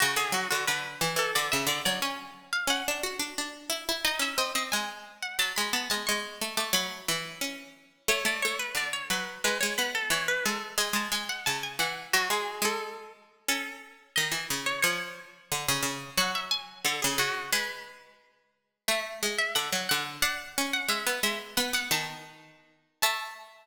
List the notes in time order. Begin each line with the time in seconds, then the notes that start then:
0.00 C#3 F#4
0.16 D3 G#4
0.32 F#3 F#4
0.50 D3 F#4
0.67 D3 B4
1.01 E3
1.16 E3 A4
1.35 D3 D5
1.52 C#3 E5
1.67 D3 D5
1.85 F#3 D5
2.02 C#4 G#5
2.53 F5
2.67 C#4 F#5
2.88 D4
3.03 F#4
3.19 D4
3.38 D4
3.70 E4
3.89 E4
4.04 D#4 D#5
4.19 C#4 E5
4.38 C4 D#5
4.55 C4 D#5
4.72 G#3 G#5
5.22 F#5
5.39 F#3 A5
5.56 G#3 B5
5.73 B3 A5
5.90 G#3 A5
6.07 G#3 C#6
6.41 A3
6.57 A3 D6
6.73 F#3 B5
7.08 E3
7.41 C#4
8.08 A3 C#5
8.25 A3 D5
8.42 A3 C#5
8.59 B4
8.75 D3 D5
8.93 C#5
9.10 F#3 B4
9.44 G#3 B4
9.60 G#3 C#5
9.78 B3 B4
9.95 A4
10.10 E3 C#5
10.28 B4
10.45 G#3 A4
10.78 G#3 G#5
10.93 G#3 A5
11.12 G#3 G#5
11.29 F#5
11.46 C#3 A5
11.63 G#5
11.79 E3 F#5
12.13 F#3 F#4
12.30 G#3 G#4
12.62 G#3 A4
13.48 C#4 A4
14.16 D#3 D#5
14.32 E3
14.50 C#3
14.66 C#5
14.82 F3 C#5
15.52 D3
15.68 C#3
15.83 C#3
16.17 F#3 F#5
16.35 E5
16.51 G#5
16.85 D3 A4
17.02 C#3 G#4
17.18 C#3 F#4
17.52 G#3 B4
18.88 A3 E5
19.23 G#3
19.38 E5
19.55 D3 F#5
19.72 F#3
19.89 D3 F#5
20.22 D4 F#5
20.58 C#4
20.73 F#5
20.88 G#3 E5
21.07 B3
21.23 G#3 E5
21.57 B3 F#5
21.73 B3 F#5
21.91 D#3 A5
23.02 A3 A5